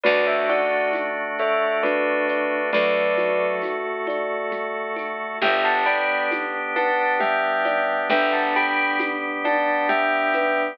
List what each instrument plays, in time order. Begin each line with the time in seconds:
0.04 electric bass (finger) D2, drawbar organ A3 D4 F#4, kalimba F#4, tubular bells B4 D5, low conga, shaker
0.27 tubular bells C#5 E5
0.48 kalimba D5, tubular bells D5 F#5, high conga, shaker
0.93 kalimba F#4, tambourine, high conga, shaker
1.38 kalimba A4, tubular bells C#5 E5, shaker
1.83 ocarina D4, kalimba F#4, tubular bells B4 D5, low conga, shaker
2.28 kalimba D5, shaker
2.73 electric bass (finger) D2, ocarina F#3, drawbar organ A3 F#4 A4, kalimba A4, tubular bells B4 D5, low conga, shaker
3.17 kalimba F#4, high conga, shaker
3.62 kalimba F#4, tambourine, high conga, shaker
4.07 kalimba D5, high conga, shaker
4.51 kalimba F#4, low conga, shaker
4.96 kalimba A4, high conga, shaker
5.42 electric bass (finger) G1, drawbar organ B3 D4 G4, kalimba G4, tubular bells E5 G5, low conga, shaker
5.65 tubular bells F#5 A5
5.86 kalimba D5, tubular bells G5 B5, shaker
6.31 kalimba G4, tambourine, high conga, shaker
6.76 kalimba B4, tubular bells F#5 A5, high conga, shaker
7.20 ocarina G3, kalimba G4, tubular bells E5 G5, low conga, shaker
7.65 kalimba D5, high conga, shaker
8.10 electric bass (finger) G1, drawbar organ G3 B3 G4, ocarina D4, kalimba B4, tubular bells E5 G5, low conga, shaker
8.32 tubular bells F#5 A5
8.55 kalimba G4, tubular bells G5 B5, shaker
8.99 kalimba G4, tambourine, high conga, shaker
9.44 kalimba D5, tubular bells F#5 A5, high conga, shaker
9.88 kalimba G4, tubular bells E5 G5, low conga, shaker
10.33 kalimba B4, high conga, shaker